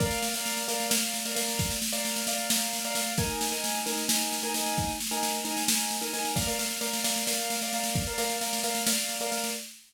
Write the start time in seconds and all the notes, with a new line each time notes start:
0.00 A#4 D5 F5, kick, snare
0.11 snare
0.23 snare
0.34 A#4 D5 F5, snare
0.46 snare
0.57 snare
0.68 A#4 D5 F5, snare
0.80 snare
0.90 A#4 D5 F5, snare
1.02 snare
1.14 snare
1.25 A#4 D5 F5, snare
1.35 A#4 D5 F5, snare
1.48 snare
1.59 kick, snare
1.70 snare
1.82 snare
1.93 A#4 D5 F5, snare
2.05 snare
2.16 snare
2.27 A#4 D5 F5, snare
2.38 snare
2.50 A#4 D5 F5, snare
2.61 snare
2.73 snare
2.85 A#4 D5 F5, snare
2.95 A#4 D5 F5, snare
3.06 snare
3.18 D#4 A#4 G#5, kick, snare
3.30 snare
3.41 snare
3.52 D#4 A#4 G#5, snare
3.64 snare
3.75 snare
3.86 D#4 A#4 G#5, snare
3.97 snare
4.08 D#4 A#4 G#5, snare
4.21 snare
4.32 snare
4.43 D#4 A#4 G#5, snare
4.54 D#4 A#4 G#5, snare
4.66 snare
4.77 kick, snare
4.89 snare
5.00 snare
5.11 D#4 A#4 G#5, snare
5.23 snare
5.34 snare
5.45 D#4 A#4 G#5, snare
5.57 snare
5.68 D#4 A#4 G#5, snare
5.80 snare
5.91 snare
6.01 D#4 A#4 G#5, snare
6.13 D#4 A#4 G#5, snare
6.25 snare
6.36 A#4 D5 F5, kick, snare
6.47 A#4 D5 F5, snare
6.59 A#4 D5 F5, snare
6.71 snare
6.81 A#4 D5 F5, snare
6.93 snare
7.04 A#4 D5 F5, snare
7.16 snare
7.27 A#4 D5 F5, snare
7.39 snare
7.50 snare
7.61 A#4 D5 F5, snare
7.73 A#4 D5 F5, snare
7.84 snare
7.95 kick, snare
8.07 A#4 D5 F5, snare
8.18 A#4 D5 F5, snare
8.30 snare
8.41 A#4 D5 F5, snare
8.53 snare
8.63 A#4 D5 F5, snare
8.75 snare
8.87 A#4 D5 F5, snare
8.98 snare
9.09 snare
9.20 A#4 D5 F5, snare
9.31 A#4 D5 F5, snare
9.44 snare